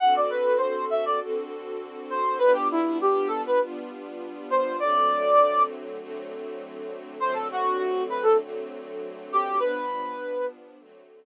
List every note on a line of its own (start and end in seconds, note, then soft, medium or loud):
0.00 1.19 D3 medium
0.00 1.19 C4 medium
0.00 1.19 F#4 loud
0.00 1.19 A4 loud
0.00 0.14 F#5 loud
0.16 0.30 D5 medium
0.30 0.58 B4 medium
0.58 0.85 C5 medium
0.90 1.04 E5 medium
1.05 1.20 D5 medium
1.21 2.40 D3 loud
1.21 2.40 C4 medium
1.21 2.40 F#4 loud
1.21 2.40 A4 loud
2.10 2.38 C5 medium
2.39 3.58 G3 loud
2.39 3.58 B3 loud
2.39 3.58 D4 loud
2.39 3.58 F4 medium
2.39 2.53 B4 medium
2.53 2.68 G4 medium
2.71 2.98 E4 medium
3.01 3.28 G4 medium
3.28 3.42 A4 medium
3.46 3.60 B4 medium
3.61 4.79 G3 medium
3.61 4.79 B3 loud
3.61 4.79 D4 medium
3.61 4.79 F4 loud
4.50 4.77 C5 medium
4.80 5.99 D3 loud
4.80 5.99 F#3 medium
4.80 5.99 A3 medium
4.80 5.99 C4 loud
4.80 5.62 D5 medium
6.00 7.19 D3 medium
6.00 7.19 F#3 medium
6.00 7.19 A3 medium
6.00 7.19 C4 medium
7.20 8.39 D3 loud
7.20 8.39 F#3 medium
7.20 8.39 A3 medium
7.20 8.39 C4 loud
7.20 7.34 C5 medium
7.33 7.48 A4 medium
7.52 7.78 F#4 medium
7.78 8.03 F#4 medium
8.09 8.24 B4 medium
8.23 8.37 A4 medium
8.40 9.59 D3 medium
8.40 9.59 F#3 medium
8.40 9.59 A3 medium
8.40 9.59 C4 medium
9.32 9.59 G4 medium
9.59 10.79 G2 medium
9.59 10.79 F3 medium
9.59 10.79 B3 loud
9.59 10.79 D4 loud
9.59 10.46 B4 medium
10.79 11.25 D3 medium
10.79 11.25 F#3 loud
10.79 11.25 A3 loud
10.79 11.25 C4 medium